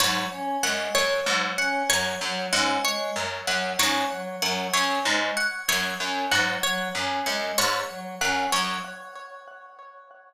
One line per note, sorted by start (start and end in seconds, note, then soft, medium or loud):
0.00 0.25 G#2 medium
0.00 0.25 F#3 medium
0.00 0.25 C#5 medium
0.32 0.57 C#4 medium
0.63 0.88 F#2 medium
0.63 0.89 G#3 medium
0.63 0.89 F#5 medium
0.95 1.20 F#2 medium
0.95 1.20 C#5 medium
1.26 1.52 G#2 medium
1.26 1.51 F#3 medium
1.57 1.83 C#4 medium
1.57 1.83 F#5 medium
1.89 2.15 F#2 medium
1.89 2.15 F#3 medium
1.89 2.15 C#5 medium
2.21 2.46 F#2 medium
2.21 2.47 F#3 medium
2.53 2.78 G#2 medium
2.53 2.78 C#4 medium
2.53 2.78 F#5 medium
2.85 3.10 G#3 medium
2.85 3.10 C#5 medium
3.16 3.41 F#2 medium
3.47 3.73 F#2 medium
3.47 3.73 F#3 medium
3.47 3.73 F#5 medium
3.79 4.04 G#2 medium
3.79 4.05 C#4 medium
3.79 4.05 C#5 medium
4.11 4.36 F#3 medium
4.42 4.67 F#2 medium
4.42 4.67 F#3 medium
4.42 4.67 F#5 medium
4.74 4.99 F#2 medium
4.74 4.99 C#4 medium
4.74 4.99 C#5 medium
5.05 5.31 G#2 medium
5.05 5.31 G#3 medium
5.37 5.62 F#5 medium
5.68 5.94 F#2 medium
5.68 5.94 F#3 medium
5.68 5.94 C#5 medium
6.00 6.25 F#2 medium
6.00 6.25 C#4 medium
6.31 6.57 G#2 medium
6.31 6.57 F#3 medium
6.31 6.57 F#5 medium
6.63 6.89 F#3 medium
6.63 6.89 C#5 medium
6.95 7.20 F#2 medium
6.95 7.20 C#4 medium
7.26 7.52 F#2 medium
7.26 7.52 G#3 medium
7.26 7.51 F#5 medium
7.58 7.83 G#2 medium
7.58 7.83 C#5 medium
7.90 8.15 F#3 medium
8.21 8.46 F#2 medium
8.21 8.46 C#4 medium
8.21 8.47 F#5 medium
8.52 8.78 F#2 medium
8.52 8.78 F#3 medium
8.52 8.78 C#5 medium